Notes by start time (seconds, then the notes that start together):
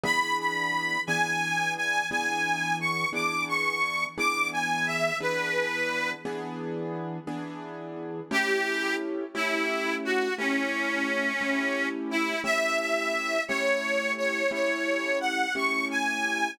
0.03 E3 B3 D4 G#4 B5
0.39 B5
1.07 E3 B3 D4 G#4 G#5
1.77 G#5
2.10 E3 B3 D4 G#4 G#5
2.80 C#6
3.13 E3 B3 D4 G#4 D6
3.48 C#6
4.18 E3 B3 D4 G#4 D6
4.53 G#5
4.86 E5
5.21 E3 B3 D4 G#4 B4
6.25 E3 B3 D4 G#4
7.27 E3 B3 D4 G#4
8.31 A3 C#4 E4 G4
9.35 A3 C#4 E4 G4
10.05 F#4
10.38 A3 C#4 E4 G4
11.41 A3 C#4 E4 G4
12.11 E4
12.44 A3 C#4 E4 G4 E5
12.79 E5
13.48 A3 C#4 E4 G4 C#5
14.17 C#5
14.51 A3 C#4 E4 G4 C#5
15.21 F#5
15.55 A3 C#4 E4 G4 C#6
15.91 G#5